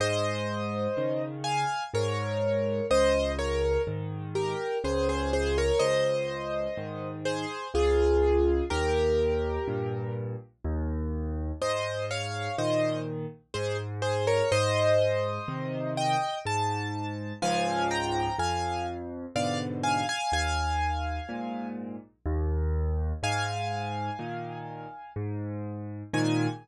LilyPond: <<
  \new Staff \with { instrumentName = "Acoustic Grand Piano" } { \time 3/4 \key aes \major \tempo 4 = 62 <c'' ees''>4. <f'' aes''>8 <bes' des''>4 | <c'' ees''>8 <bes' des''>8 r8 <g' bes'>8 <aes' c''>16 <aes' c''>16 <aes' c''>16 <bes' des''>16 | <c'' ees''>4. <aes' c''>8 <f' aes'>4 | <g' bes'>4. r4. |
<c'' ees''>8 <des'' f''>8 <c'' ees''>8 r8 <aes' c''>16 r16 <aes' c''>16 <bes' des''>16 | <c'' ees''>4. <ees'' g''>8 a''4 | <f'' aes''>8 <g'' bes''>8 <f'' aes''>8 r8 <d'' f''>16 r16 <f'' aes''>16 <f'' aes''>16 | <f'' aes''>4. r4. |
<f'' aes''>2 r4 | aes''4 r2 | }
  \new Staff \with { instrumentName = "Acoustic Grand Piano" } { \clef bass \time 3/4 \key aes \major aes,4 <des ees>4 aes,4 | des,4 <aes, ees>4 des,4 | des,4 <aes, ees>4 des,4 | ees,4 <g, bes,>4 ees,4 |
aes,4 <bes, ees>4 aes,4 | aes,4 <c ees>4 aes,4 | <des, aes, f>4 f,4 <aes, ces d>4 | ees,4 <aes, bes,>4 ees,4 |
aes,4 <bes, ees>4 aes,4 | <aes, bes, ees>4 r2 | }
>>